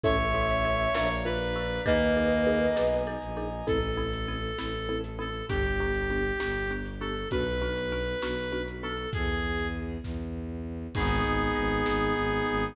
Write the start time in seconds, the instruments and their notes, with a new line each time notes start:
0.03 violin A1, marimba C#4 E4 A4, clarinet C#5, flute C#5 E5, brass section C#5 E5 A5, kick, closed hi-hat
0.34 marimba C#4 E4 A4
0.49 closed hi-hat
0.65 marimba C#4 E4 A4
0.94 violin A#1, marimba D4 F4 A#4, brass section D5 F5 A#5, snare
1.25 marimba D4 F4 A#4, clarinet B4
1.40 closed hi-hat
1.56 marimba D4 F4 A#4
1.85 violin D#2, clarinet A#3, marimba D#4 G#4 A#4, flute B4 D#5, brass section D#5 G#5 A#5, kick, closed hi-hat
2.17 marimba D#4 G#4 A#4
2.31 closed hi-hat
2.47 marimba D#4 G#4 A#4
2.76 violin B1, marimba D#4 G#4 A#4, snare
3.07 marimba D#4 G#4 A#4
3.21 violin A#1, closed hi-hat
3.37 marimba D#4 G#4 A#4
3.67 violin A1, marimba C4 E4 A4, clarinet A4, kick, closed hi-hat
3.97 marimba C4 E4 A4
4.13 closed hi-hat
4.28 marimba C4 E4 A4
4.58 violin A1, marimba C4 E4 A4, snare
4.89 marimba C4 E4 A4
5.04 closed hi-hat
5.19 marimba C4 E4 A4, clarinet A4
5.48 violin G1, marimba B3 D4 G4, clarinet G4, kick, closed hi-hat
5.80 marimba B3 D4 G4
5.94 closed hi-hat
6.10 marimba B3 D4 G4
6.40 violin G1, marimba B3 D4 G4, snare
6.71 marimba B3 D4 G4
6.85 closed hi-hat
7.00 marimba B3 D4 G4, clarinet A4
7.31 violin B1, marimba B3 D4 F#4, clarinet B4, kick, closed hi-hat
7.61 marimba B3 D4 F#4
7.77 closed hi-hat
7.92 marimba B3 D4 F#4
8.22 violin B1, marimba B3 D4 F#4, snare
8.52 marimba B3 D4 F#4
8.68 closed hi-hat
8.82 marimba B3 D4 F#4, clarinet A4
9.13 violin E2, clarinet G#4, kick, closed hi-hat
9.58 closed hi-hat
10.03 violin E2, kick, snare
10.95 violin G#1, brass section B3 D#4 G#4, marimba D#4, clarinet G#4, kick, crash
11.24 violin G#1, marimba G#4, closed hi-hat
11.55 violin G#1, marimba B4, closed hi-hat
11.85 violin G#1, marimba G#4, snare
12.16 violin G#1, marimba D#4, closed hi-hat
12.46 violin G#1, marimba G#4, closed hi-hat